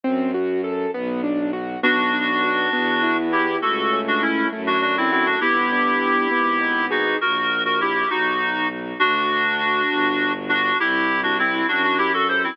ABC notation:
X:1
M:6/8
L:1/16
Q:3/8=67
K:Em
V:1 name="Clarinet"
z12 | [DF]10 [EG]2 | [FA]3 [DF] [^CE]2 z [DF] [DF] [=CE] [CE] [DF] | [EG]10 [^DF]2 |
[F^A]3 [FA] [EG]2 [^DF]4 z2 | [K:G] [DF]10 [DF]2 | [EG]3 [DF] [CE]2 [DF] [DF] [EG] [FA] [Ac] [CE] |]
V:2 name="Acoustic Grand Piano"
C2 F2 A2 B,2 D2 F2 | B,2 D2 F2 B,2 E2 G2 | A,2 ^C2 E2 A,2 D2 F2 | B,2 D2 G2 B,2 ^D2 ^G2 |
z12 | [K:G] z12 | z12 |]
V:3 name="Violin" clef=bass
F,,6 B,,,6 | B,,,6 E,,6 | ^C,,6 F,,6 | G,,,6 ^G,,,6 |
^A,,,6 B,,,6 | [K:G] D,,6 G,,,6 | C,,6 F,,6 |]